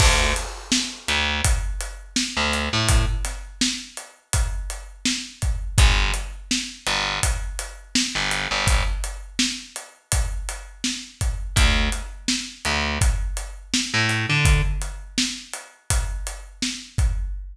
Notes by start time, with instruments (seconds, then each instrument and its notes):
0.00 electric bass (finger) D2, kick, crash
0.36 closed hi-hat
0.72 snare
1.08 electric bass (finger) D2, closed hi-hat
1.44 kick, closed hi-hat
1.81 closed hi-hat
2.16 snare
2.37 electric bass (finger) D2
2.53 closed hi-hat
2.73 electric bass (finger) A2
2.89 kick, closed hi-hat
3.25 snare, closed hi-hat
3.61 snare
3.97 closed hi-hat
4.33 kick, closed hi-hat
4.70 closed hi-hat
5.05 snare
5.42 kick, closed hi-hat
5.78 electric bass (finger) G1, kick, closed hi-hat
6.14 closed hi-hat
6.51 snare
6.87 electric bass (finger) G1, closed hi-hat
7.23 kick, closed hi-hat
7.59 closed hi-hat
7.95 snare
8.15 electric bass (finger) G1
8.31 closed hi-hat
8.51 electric bass (finger) G1
8.67 kick, closed hi-hat
9.04 closed hi-hat
9.39 snare
9.76 closed hi-hat
10.12 kick, closed hi-hat
10.49 closed hi-hat
10.84 snare
11.21 kick, closed hi-hat
11.56 electric bass (finger) D2, kick, closed hi-hat
11.92 closed hi-hat
12.28 snare
12.65 electric bass (finger) D2, closed hi-hat
13.01 kick, closed hi-hat
13.37 closed hi-hat
13.74 snare
13.94 electric bass (finger) A2
14.09 closed hi-hat
14.30 electric bass (finger) D3
14.45 kick, closed hi-hat
14.82 closed hi-hat
15.18 snare
15.53 closed hi-hat
15.90 kick, closed hi-hat
16.27 closed hi-hat
16.62 snare
16.98 kick, closed hi-hat